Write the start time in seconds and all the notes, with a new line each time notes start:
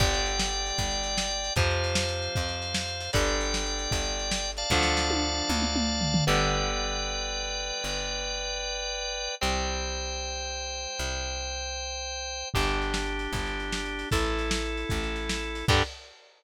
0.00 G1 D3 G3 D5 G5, kick, crash
0.14 closed hi-hat
0.26 closed hi-hat
0.39 snare
0.53 closed hi-hat
0.66 closed hi-hat
0.78 G1, kick, closed hi-hat
0.91 closed hi-hat
1.03 closed hi-hat
1.18 snare
1.30 closed hi-hat
1.44 closed hi-hat
1.56 F2 C3 F3 C5 F5, kick, closed hi-hat
1.70 closed hi-hat
1.84 closed hi-hat
1.95 snare
2.09 closed hi-hat
2.22 closed hi-hat
2.35 F2, kick, closed hi-hat
2.48 closed hi-hat
2.62 closed hi-hat
2.74 snare
2.88 closed hi-hat
3.00 closed hi-hat
3.13 G1 D3 G3 D5 G5, kick, closed hi-hat
3.27 closed hi-hat
3.41 closed hi-hat
3.54 snare
3.66 closed hi-hat
3.79 closed hi-hat
3.91 G1, kick, closed hi-hat
4.05 closed hi-hat
4.19 closed hi-hat
4.31 snare
4.45 closed hi-hat
4.57 D5 F5 A5, closed hi-hat
4.70 D2 D3 F3 A3, kick, snare
4.83 snare
4.97 snare
5.10 high tom
5.49 D2, mid tom
5.62 mid tom
5.76 mid tom
6.01 floor tom
6.14 floor tom
6.27 G1 D3 G3 B3 B4 D5 G5
7.84 G1
9.41 C2 G3 C4 C5 G5
10.99 C2
12.54 G1 D4 G4, kick, crash
12.68 closed hi-hat
12.82 closed hi-hat
12.94 snare
13.06 closed hi-hat
13.19 closed hi-hat
13.33 G1, kick, closed hi-hat
13.46 closed hi-hat
13.60 closed hi-hat
13.72 snare
13.85 closed hi-hat
13.99 closed hi-hat
14.11 A1 E4 A4, kick, closed hi-hat
14.24 closed hi-hat
14.39 closed hi-hat
14.51 snare
14.65 closed hi-hat
14.77 closed hi-hat
14.89 A1, kick, closed hi-hat
15.03 closed hi-hat
15.16 closed hi-hat
15.29 snare
15.43 closed hi-hat
15.55 closed hi-hat
15.68 G2 D3 G3 D4 G4, kick, crash